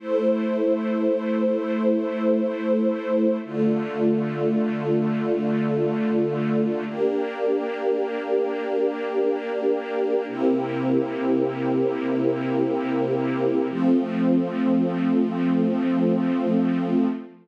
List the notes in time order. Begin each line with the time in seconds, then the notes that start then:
0.00 A3 E4 C5
3.44 D3 A3 F4
6.86 A#3 D4 G4
10.28 C3 A#3 E4 G4
13.70 F3 A3 C4